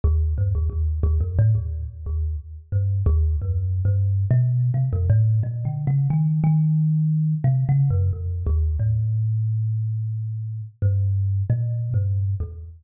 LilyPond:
\new Staff { \clef bass \time 6/4 \partial 4 \tempo 4 = 89 dis,8 g,16 dis,16 | dis,8 dis,16 f,16 a,16 dis,8 r16 dis,8 r8 g,8 dis,8 \tuplet 3/2 { fis,4 g,4 b,4 } | c16 f,16 a,8 \tuplet 3/2 { ais,8 d8 cis8 } dis8 dis4. \tuplet 3/2 { c8 cis8 fis,8 } f,8 dis,8 | a,2. g,4 \tuplet 3/2 { ais,4 g,4 e,4 } | }